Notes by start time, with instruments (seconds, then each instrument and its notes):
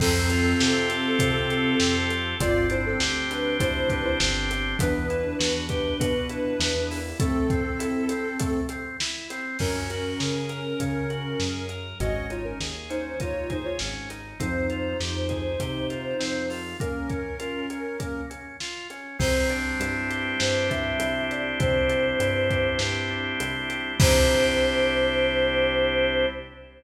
0.00 synth bass 1 F2, drawbar organ C4, ocarina C4 A4, kick, crash
0.30 drawbar organ F4, closed hi-hat
0.59 synth bass 1 C3, drawbar organ G4, snare
0.90 drawbar organ A4, closed hi-hat
1.19 synth bass 1 C3, drawbar organ C4, kick, closed hi-hat
1.50 drawbar organ F4, closed hi-hat
1.80 synth bass 1 F2, drawbar organ G4, snare
2.10 drawbar organ A4, closed hi-hat
2.40 synth bass 1 G1, drawbar organ C4, ocarina F4 D5, kick, closed hi-hat
2.69 drawbar organ D4, ocarina E4 C5, closed hi-hat
2.86 ocarina C4 A4
3.00 synth bass 1 D2, drawbar organ G4, snare
3.29 drawbar organ C4, ocarina D4 B4, closed hi-hat
3.60 synth bass 1 D2, drawbar organ D4, ocarina E4 C5, kick, closed hi-hat
3.90 ocarina D4 B4, drawbar organ G4, kick, closed hi-hat
4.05 ocarina E4 C5
4.20 synth bass 1 G1, drawbar organ C4, snare
4.50 drawbar organ D4, closed hi-hat
4.79 synth bass 1 E2, drawbar organ B3, ocarina D4 B4, kick, closed hi-hat
5.10 drawbar organ E4, closed hi-hat
5.39 synth bass 1 E2, drawbar organ F#4, snare
5.69 drawbar organ G4, kick, closed hi-hat
6.00 synth bass 1 B2, drawbar organ F#4, kick, closed hi-hat
6.29 drawbar organ E4, closed hi-hat
6.60 synth bass 1 E2, drawbar organ B3, snare
6.91 drawbar organ E4, open hi-hat
7.20 drawbar organ A3, ocarina C4 A4, kick, closed hi-hat
7.50 drawbar organ C4, kick, closed hi-hat
7.79 drawbar organ E4, closed hi-hat
8.09 drawbar organ C4, closed hi-hat
8.39 drawbar organ A3, kick, closed hi-hat
8.69 drawbar organ C4, closed hi-hat
9.00 drawbar organ E4, snare
9.30 drawbar organ C4, closed hi-hat
9.59 synth bass 1 F#2, drawbar organ C#4, ocarina C#4 A#4, kick, crash
9.90 drawbar organ F#4, closed hi-hat
10.20 synth bass 1 C#3, drawbar organ G#4, snare
10.49 drawbar organ A#4, closed hi-hat
10.80 synth bass 1 C#3, drawbar organ C#4, kick, closed hi-hat
11.10 drawbar organ F#4, closed hi-hat
11.40 synth bass 1 F#2, drawbar organ G#4, snare
11.69 drawbar organ A#4, closed hi-hat
12.00 synth bass 1 G#1, drawbar organ C#4, ocarina F#4 D#5, kick, closed hi-hat
12.30 drawbar organ D#4, ocarina F4 C#5, closed hi-hat
12.44 ocarina C#4 A#4
12.60 synth bass 1 D#2, drawbar organ G#4, snare
12.89 drawbar organ C#4, ocarina D#4 C5, closed hi-hat
13.20 synth bass 1 D#2, drawbar organ D#4, ocarina F4 C#5, kick, closed hi-hat
13.50 ocarina D#4 C5, drawbar organ G#4, kick, closed hi-hat
13.65 ocarina F4 C#5
13.79 synth bass 1 G#1, drawbar organ C#4, snare
14.10 drawbar organ D#4, closed hi-hat
14.39 synth bass 1 F2, drawbar organ C4, ocarina D#4 C5, kick, closed hi-hat
14.70 drawbar organ F4, closed hi-hat
15.00 synth bass 1 F2, drawbar organ G4, snare
15.29 drawbar organ G#4, kick, closed hi-hat
15.60 synth bass 1 C3, drawbar organ G4, kick, closed hi-hat
15.90 drawbar organ F4, closed hi-hat
16.19 synth bass 1 F2, drawbar organ C4, snare
16.50 drawbar organ F4, open hi-hat
16.80 drawbar organ A#3, ocarina C#4 A#4, kick, closed hi-hat
17.09 drawbar organ C#4, kick, closed hi-hat
17.39 drawbar organ F4, closed hi-hat
17.70 drawbar organ C#4, closed hi-hat
17.99 drawbar organ A#3, kick, closed hi-hat
18.30 drawbar organ C#4, closed hi-hat
18.60 drawbar organ F4, snare
18.90 drawbar organ C#4, closed hi-hat
19.19 synth bass 1 C2, drawbar organ C4, choir aahs C5, kick, crash
19.49 drawbar organ D4, closed hi-hat
19.80 synth bass 1 G2, drawbar organ E4, closed hi-hat
20.10 drawbar organ G4, closed hi-hat
20.39 synth bass 1 G2, drawbar organ C4, choir aahs C5, snare
20.69 drawbar organ D4, choir aahs E5, kick, closed hi-hat
21.00 synth bass 1 C2, drawbar organ E4, closed hi-hat
21.30 drawbar organ G4, choir aahs D5, closed hi-hat
21.59 synth bass 1 C2, drawbar organ C4, choir aahs C5, kick, closed hi-hat
21.89 drawbar organ D4, closed hi-hat
22.20 synth bass 1 G2, drawbar organ E4, closed hi-hat
22.49 drawbar organ G4, kick, closed hi-hat
22.79 synth bass 1 G2, drawbar organ C4, snare
23.11 drawbar organ D4
23.40 synth bass 1 C2, drawbar organ E4, closed hi-hat
23.70 drawbar organ G4, closed hi-hat
24.00 synth bass 1 C2, drawbar organ C4 D4 E4 G4, choir aahs C5, kick, crash